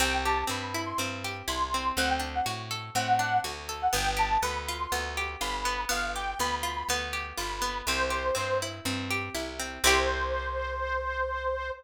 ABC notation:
X:1
M:4/4
L:1/16
Q:1/4=122
K:C
V:1 name="Accordion"
g2 a2 b3 c' z4 c'4 | ^f g z f z4 f4 z3 f | g2 a2 b3 c' z4 b4 | f2 g2 b3 b z4 b4 |
c6 z10 | c16 |]
V:2 name="Pizzicato Strings"
C2 G2 C2 E2 C2 G2 E2 C2 | C2 D2 ^F2 A2 C2 D2 F2 A2 | B,2 G2 B,2 F2 B,2 G2 F2 B,2 | B,2 G2 B,2 F2 B,2 G2 F2 B,2 |
C2 G2 C2 E2 C2 G2 E2 C2 | [CEG]16 |]
V:3 name="Electric Bass (finger)" clef=bass
C,,4 G,,4 G,,4 C,,4 | D,,4 A,,4 A,,4 D,,4 | G,,,4 D,,4 D,,4 G,,,4 | G,,,4 D,,4 D,,4 G,,,4 |
C,,4 G,,4 G,,4 C,,4 | C,,16 |]